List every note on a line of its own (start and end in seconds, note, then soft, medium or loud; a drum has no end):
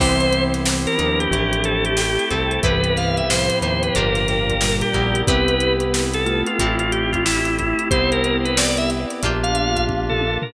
0.00 0.87 C2 loud
0.00 0.97 E3 medium
0.00 1.30 B3 medium
0.00 0.97 C4 medium
0.00 1.30 C4 medium
0.00 0.16 E4 medium
0.00 1.30 E4 medium
0.00 0.16 G4 loud
0.00 1.30 G4 medium
0.00 0.65 B4 loud
0.00 0.16 B4 loud
0.00 0.43 C5 loud
0.00 0.65 C5 medium
0.00 0.16 C5 medium
0.00 0.65 E5 loud
0.00 0.65 G5 loud
0.00 kick loud
0.00 crash loud
0.20 closed hi-hat medium
0.33 closed hi-hat medium
0.54 snare soft
0.54 closed hi-hat medium
0.65 1.31 B4 medium
0.65 1.31 C5 loud
0.65 1.31 G5 medium
0.65 1.31 B5 loud
0.65 snare loud
0.87 1.19 A#4 loud
0.87 closed hi-hat medium
0.98 1.28 D#2 medium
0.98 1.93 F3 medium
0.98 1.93 D4 medium
0.98 1.28 D#4 medium
0.98 closed hi-hat medium
1.20 1.51 G4 loud
1.20 closed hi-hat medium
1.31 2.19 A1 loud
1.31 2.62 A3 medium
1.31 2.62 C4 medium
1.31 2.62 E4 medium
1.31 2.62 G4 medium
1.31 1.97 A4 loud
1.31 1.97 C5 medium
1.31 1.98 E5 loud
1.31 1.97 G5 loud
1.31 kick medium
1.31 closed hi-hat loud
1.52 1.64 G4 loud
1.52 closed hi-hat medium
1.64 1.84 A4 loud
1.64 closed hi-hat medium
1.85 1.97 G4 loud
1.85 closed hi-hat medium
1.97 2.29 G4 loud
1.97 2.63 A4 medium
1.97 2.63 C5 loud
1.97 2.63 G5 loud
1.97 2.63 A5 medium
1.97 snare loud
2.19 closed hi-hat medium
2.30 2.60 C2 loud
2.30 2.60 C4 medium
2.30 2.60 A4 loud
2.30 kick medium
2.30 closed hi-hat medium
2.51 closed hi-hat medium
2.63 3.51 C2 medium
2.63 3.22 G2 medium
2.63 3.22 E3 medium
2.63 3.94 B3 medium
2.63 3.94 C4 medium
2.63 2.80 E4 loud
2.63 3.94 E4 medium
2.63 3.94 G4 medium
2.63 2.80 G4 loud
2.63 2.96 B4 loud
2.63 3.28 B4 medium
2.63 2.80 B4 medium
2.63 3.28 C5 loud
2.63 2.80 C5 loud
2.63 3.29 E5 loud
2.63 3.28 G5 medium
2.63 kick loud
2.63 closed hi-hat medium
2.84 closed hi-hat medium
2.97 3.16 F5 loud
2.97 snare soft
2.97 closed hi-hat medium
3.17 3.29 E5 medium
3.17 closed hi-hat medium
3.29 4.55 A2 medium
3.29 4.55 F3 medium
3.29 3.94 B4 loud
3.29 3.94 C5 loud
3.29 3.58 C5 loud
3.29 3.94 G5 loud
3.29 3.94 B5 loud
3.29 snare loud
3.50 closed hi-hat medium
3.62 3.91 D#2 loud
3.62 3.92 D#4 medium
3.62 3.82 C5 loud
3.62 closed hi-hat medium
3.83 3.95 B4 medium
3.83 closed hi-hat medium
3.95 4.84 G1 loud
3.95 4.90 A#3 medium
3.95 4.90 D4 medium
3.95 4.52 D4 loud
3.95 4.90 F4 medium
3.95 4.52 F4 medium
3.95 4.90 G4 medium
3.95 4.52 G4 loud
3.95 4.27 A#4 loud
3.95 4.61 A#4 medium
3.95 4.52 A#4 loud
3.95 4.61 D5 loud
3.95 4.61 F5 loud
3.95 4.61 G5 loud
3.95 kick medium
3.95 closed hi-hat loud
4.15 snare soft
4.15 closed hi-hat medium
4.28 4.76 A#4 loud
4.28 snare soft
4.28 closed hi-hat medium
4.49 kick medium
4.49 closed hi-hat medium
4.61 5.23 A#2 medium
4.61 5.23 G3 medium
4.61 5.27 A#4 loud
4.61 5.27 D5 loud
4.61 5.27 G5 medium
4.61 5.27 A#5 medium
4.61 snare loud
4.81 5.21 G4 loud
4.81 closed hi-hat medium
4.93 5.24 A#1 medium
4.93 5.23 A#3 medium
4.93 6.57 B3 medium
4.93 6.57 C4 medium
4.93 6.57 E4 medium
4.93 6.57 G4 medium
4.93 kick medium
4.93 closed hi-hat medium
5.15 closed hi-hat medium
5.27 6.44 C2 loud
5.27 5.92 B3 loud
5.27 6.10 B3 medium
5.27 5.92 C4 loud
5.27 5.69 C4 loud
5.27 5.92 E4 medium
5.27 5.69 E4 medium
5.27 5.92 G4 loud
5.27 6.10 G4 medium
5.27 5.69 G4 loud
5.27 5.73 B4 loud
5.27 5.69 B4 loud
5.27 kick loud
5.27 closed hi-hat loud
5.48 closed hi-hat medium
5.60 closed hi-hat medium
5.80 closed hi-hat medium
5.92 6.58 B3 loud
5.92 6.58 C4 loud
5.92 6.58 G4 loud
5.92 6.58 B4 loud
5.92 snare loud
6.14 6.42 A4 loud
6.14 closed hi-hat medium
6.26 7.21 A3 medium
6.26 7.21 F4 medium
6.26 closed hi-hat medium
6.47 6.75 F4 medium
6.47 closed hi-hat medium
6.59 7.74 A1 loud
6.59 7.24 A3 loud
6.59 7.89 A3 medium
6.59 7.24 C4 loud
6.59 7.89 C4 medium
6.59 7.16 C4 loud
6.59 7.24 E4 medium
6.59 7.89 E4 medium
6.59 7.16 E4 medium
6.59 7.24 G4 medium
6.59 7.89 G4 medium
6.59 7.16 G4 loud
6.59 7.16 A4 loud
6.59 kick medium
6.59 closed hi-hat loud
6.79 6.91 F4 loud
6.79 closed hi-hat medium
6.92 7.11 G4 medium
6.92 closed hi-hat medium
7.12 7.24 F4 loud
7.12 kick medium
7.12 closed hi-hat medium
7.25 7.91 A3 loud
7.25 7.91 C4 medium
7.25 7.55 E4 loud
7.25 7.91 G4 medium
7.25 7.91 A4 loud
7.25 snare loud
7.45 closed hi-hat medium
7.59 7.88 E4 medium
7.59 kick medium
7.59 closed hi-hat medium
7.79 closed hi-hat medium
7.91 9.06 C2 loud
7.91 10.16 B3 medium
7.91 9.22 B3 medium
7.91 8.57 B3 medium
7.91 9.22 C4 medium
7.91 8.57 C4 loud
7.91 9.22 E4 medium
7.91 8.58 E4 medium
7.91 10.16 G4 medium
7.91 9.22 G4 medium
7.91 8.57 G4 loud
7.91 8.10 C5 loud
7.91 kick loud
7.91 closed hi-hat loud
8.12 8.37 A#4 loud
8.12 closed hi-hat medium
8.24 closed hi-hat medium
8.45 8.57 B4 loud
8.45 closed hi-hat medium
8.57 9.23 B3 loud
8.57 9.23 C4 medium
8.57 9.21 G4 medium
8.57 9.23 B4 loud
8.57 8.77 D5 medium
8.57 snare loud
8.77 8.90 E5 loud
8.77 closed hi-hat medium
8.90 snare soft
8.90 closed hi-hat medium
9.10 snare soft
9.10 closed hi-hat medium
9.22 10.38 A#1 loud
9.22 9.87 A#3 loud
9.22 10.53 A#3 medium
9.22 9.79 A#3 medium
9.22 9.87 D4 loud
9.22 10.53 D4 medium
9.22 9.79 D4 medium
9.22 9.87 F4 loud
9.22 10.53 F4 medium
9.22 9.79 F4 loud
9.22 9.87 G4 loud
9.22 10.53 G4 medium
9.22 9.79 G4 loud
9.22 kick medium
9.22 closed hi-hat medium
9.43 9.85 F5 loud
9.43 closed hi-hat medium
9.55 closed hi-hat medium
9.76 kick medium
9.76 closed hi-hat medium
9.88 10.53 A#3 loud
9.88 10.53 D4 medium
9.88 10.53 G4 loud
9.88 10.53 A#4 loud
9.88 kick medium
9.88 high tom medium
10.09 10.37 A4 loud
10.09 floor tom medium
10.21 high tom medium
10.42 10.53 A#4 loud
10.42 floor tom loud